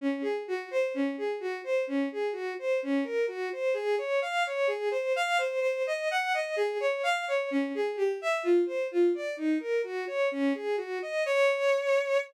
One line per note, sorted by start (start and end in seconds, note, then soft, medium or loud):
0.01 0.23 C#4 medium
0.22 0.43 G#4 medium
0.48 0.69 F#4 medium
0.71 0.92 C5 medium
0.94 1.16 C#4 medium
1.18 1.39 G#4 soft
1.40 1.62 F#4 medium
1.64 1.85 C5 medium
1.87 2.09 C#4 medium
2.12 2.34 G#4 medium
2.33 2.54 F#4 medium
2.59 2.80 C5 medium
2.83 3.04 C#4 medium
3.04 3.26 A#4 medium
3.28 3.49 F#4 medium
3.53 3.74 C5 medium
3.74 3.96 G#4 medium
3.98 4.20 C#5 medium
4.22 4.43 F5 medium
4.47 4.68 C#5 medium
4.67 4.89 G#4 medium
4.91 5.13 C5 medium
5.16 5.38 F5 medium
5.38 5.60 C5 medium
5.61 5.83 C5 medium
5.87 6.08 D#5 medium
6.11 6.33 F#5 medium
6.34 6.55 D#5 medium
6.56 6.78 G#4 medium
6.80 7.02 C#5 medium
7.03 7.25 F5 medium
7.28 7.49 C#5 medium
7.51 7.72 C#4 medium
7.75 7.96 G#4 medium
7.96 8.18 G4 medium
8.21 8.43 E5 medium
8.43 8.65 F4 medium
8.66 8.88 C5 medium
8.91 9.13 F4 medium
9.15 9.36 D5 medium
9.37 9.58 D#4 medium
9.60 9.82 A#4 medium
9.84 10.05 F#4 medium
10.07 10.29 C#5 medium
10.32 10.53 C#4 medium
10.55 10.76 G#4 medium
10.77 10.99 F#4 medium
11.02 11.24 D#5 medium
11.26 12.18 C#5 loud